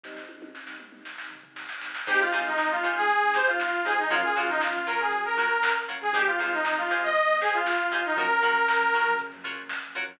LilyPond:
<<
  \new Staff \with { instrumentName = "Lead 2 (sawtooth)" } { \time 4/4 \key aes \mixolydian \tempo 4 = 118 r1 | g'16 f'16 f'16 ees'8 f'8 aes'8. c''16 f'8. aes'16 ees'16 | f'16 aes'16 f'16 ees'16 f'8 bes'16 aes'8 bes'16 bes'8. r8 aes'16 | g'16 f'16 f'16 ees'8 f'8 ees''8. aes'16 f'8. f'16 ees'16 |
bes'2 r2 | }
  \new Staff \with { instrumentName = "Pizzicato Strings" } { \time 4/4 \key aes \mixolydian r1 | <ees' g' aes' c''>8 <ees' g' aes' c''>4 <ees' g' aes' c''>4 <ees' g' aes' c''>4 <ees' g' aes' c''>8 | <f' ges' bes' des''>8 <f' ges' bes' des''>4 <f' ges' bes' des''>4 <f' ges' bes' des''>4 <f' ges' bes' des''>8 | <ees' g' aes' c''>8 <ees' g' aes' c''>4 <ees' g' aes' c''>4 <ees' g' aes' c''>4 <ees' g' aes' c''>8 |
<f' ges' bes' des''>8 <f' ges' bes' des''>4 <f' ges' bes' des''>4 <f' ges' bes' des''>4 <f' ges' bes' des''>8 | }
  \new Staff \with { instrumentName = "Electric Piano 1" } { \time 4/4 \key aes \mixolydian <aes, g c' ees'>1 | <g aes c' ees'>1 | <f ges bes des'>1 | <ees g aes c'>1 |
<f ges bes des'>1 | }
  \new Staff \with { instrumentName = "Synth Bass 1" } { \clef bass \time 4/4 \key aes \mixolydian r1 | aes,,8 aes,,8 aes,,8 aes,,16 aes,,16 aes,,16 aes,,16 aes,,4~ aes,,16 aes,16 | ges,8 ges,8 ges,8 ges,16 ges,16 ges16 ges,16 ges4~ ges16 ges,16 | aes,,8 aes,,8 aes,,8 aes,,16 ees,16 ees,16 ees,16 aes,,4~ aes,,16 aes,,16 |
ges,8 des8 ges,8 des16 ges16 des16 ges,16 des4~ des16 ges,16 | }
  \new DrumStaff \with { instrumentName = "Drums" } \drummode { \time 4/4 <bd sn>16 sn16 tommh16 tommh16 sn16 sn16 toml16 toml16 sn16 sn16 tomfh16 tomfh16 sn16 sn16 sn16 sn16 | <cymc bd>16 <hh sn>16 hh16 hh16 sn16 hh16 hh16 hh16 <hh bd>16 hh16 <hh sn>16 <hh sn>16 sn16 <hh sn>16 hh16 hh16 | <hh bd>16 <hh bd>16 hh16 <hh sn>16 sn16 hh16 hh16 hh16 <hh bd>16 hh16 <hh sn>16 hh16 sn16 hh16 hh16 hh16 | <hh bd>16 <hh bd>16 <hh sn>16 hh16 sn16 hh16 <hh sn>16 <hh sn>16 <hh bd>16 hh16 <hh sn>16 <hh sn>16 sn16 hh16 <hh sn>16 hh16 |
<hh bd>16 hh16 hh16 hh16 sn16 hh16 hh16 hh16 <hh bd>16 <hh sn>16 <hh bd sn>16 hh16 sn16 hh16 hh16 hh16 | }
>>